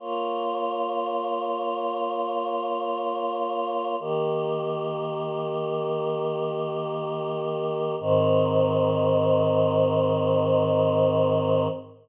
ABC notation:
X:1
M:4/4
L:1/8
Q:1/4=60
K:Ab
V:1 name="Choir Aahs"
[B,Fd]8 | [E,B,G]8 | [A,,E,C]8 |]